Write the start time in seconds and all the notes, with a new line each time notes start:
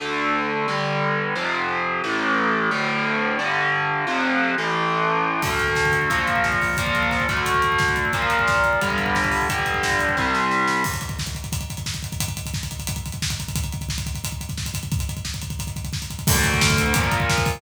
0.00 D2 D3 A3
0.68 G2 D3 G3
1.36 F2 C3 F3
2.04 A1 A2 E3
2.71 D2 A2 D3
3.39 G2 D3 G3
4.07 F2 C3 F3
4.58 A1 A2 E3
5.42 D2 D3 A3, kick, crash
5.50 kick
5.59 kick, closed hi-hat
5.68 kick
5.76 kick, snare
5.85 kick
5.92 kick, closed hi-hat
6.02 kick
6.10 A#2 F3 A#3, kick, closed hi-hat
6.19 kick
6.27 kick, closed hi-hat
6.36 kick
6.44 kick, snare
6.52 kick
6.62 kick, open hi-hat
6.70 kick
6.77 A#2 F3 A#3, kick, closed hi-hat
6.86 kick
6.95 kick, closed hi-hat
7.03 kick
7.11 kick, snare
7.20 kick
7.29 D2 D3 A3, kick, closed hi-hat
7.37 kick
7.46 kick, closed hi-hat
7.54 kick
7.62 kick, closed hi-hat
7.72 kick
7.79 kick, snare
7.88 kick
7.96 kick, closed hi-hat
8.05 kick
8.13 A#2 F3 A#3, kick, closed hi-hat
8.22 kick
8.30 kick, closed hi-hat
8.39 kick
8.47 kick, snare
8.56 kick
8.64 kick, closed hi-hat
8.73 kick
8.81 G2 D3 G3, kick, closed hi-hat
8.90 kick
8.98 kick, closed hi-hat
9.06 kick
9.15 kick, snare
9.24 kick
9.31 kick, open hi-hat
9.42 kick
9.49 G2 D3 G3, kick, closed hi-hat
9.59 kick
9.66 kick, closed hi-hat
9.74 kick
9.83 kick, snare
9.91 kick
9.99 kick, closed hi-hat
10.09 kick
10.17 C2 C3 G3, kick, snare
10.34 snare
10.51 snare
10.68 snare
10.84 kick, crash
10.93 kick, closed hi-hat
11.01 kick, closed hi-hat
11.09 kick, closed hi-hat
11.19 kick, snare
11.26 kick, closed hi-hat
11.35 kick, closed hi-hat
11.44 kick, closed hi-hat
11.52 kick, closed hi-hat
11.61 kick, closed hi-hat
11.70 kick, closed hi-hat
11.77 kick, closed hi-hat
11.86 kick, snare
11.94 kick, closed hi-hat
12.03 kick, closed hi-hat
12.12 kick, closed hi-hat
12.20 kick, closed hi-hat
12.28 kick, closed hi-hat
12.37 kick, closed hi-hat
12.46 kick, closed hi-hat
12.54 kick, snare
12.63 kick, closed hi-hat
12.71 kick, closed hi-hat
12.79 kick, closed hi-hat
12.87 kick, closed hi-hat
12.96 kick, closed hi-hat
13.06 kick, closed hi-hat
13.12 kick, closed hi-hat
13.22 kick, snare
13.30 kick, closed hi-hat
13.40 kick, closed hi-hat
13.48 kick, closed hi-hat
13.56 kick, closed hi-hat
13.64 kick, closed hi-hat
13.72 kick, closed hi-hat
13.81 kick, closed hi-hat
13.89 kick, snare
13.98 kick, closed hi-hat
14.06 kick, closed hi-hat
14.15 kick, closed hi-hat
14.24 kick, closed hi-hat
14.32 kick, closed hi-hat
14.41 kick, closed hi-hat
14.49 kick, closed hi-hat
14.57 kick, snare
14.66 kick, closed hi-hat
14.74 kick, closed hi-hat
14.83 kick, closed hi-hat
14.92 kick, closed hi-hat
14.99 kick, closed hi-hat
15.09 kick, closed hi-hat
15.17 kick, closed hi-hat
15.25 kick, snare
15.34 kick, closed hi-hat
15.42 kick, closed hi-hat
15.50 kick, closed hi-hat
15.59 kick, closed hi-hat
15.67 kick, closed hi-hat
15.76 kick, closed hi-hat
15.84 kick, closed hi-hat
15.93 kick, snare
16.02 kick, closed hi-hat
16.10 kick, closed hi-hat
16.19 kick, closed hi-hat
16.27 D2 D3 A3, kick, crash
16.36 kick
16.44 kick, closed hi-hat
16.54 kick
16.61 kick, snare
16.70 kick
16.78 kick, closed hi-hat
16.86 kick
16.94 A#2 F3 A#3, kick, closed hi-hat
17.04 kick
17.12 kick, closed hi-hat
17.20 kick
17.30 kick, snare
17.38 kick
17.45 kick, open hi-hat
17.55 kick